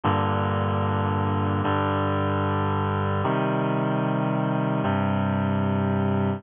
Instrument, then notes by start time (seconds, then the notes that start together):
clarinet
0.04 G2 A#2 D3
1.64 G2 D3 G3
3.24 C3 D#3 G3
4.83 G2 C3 G3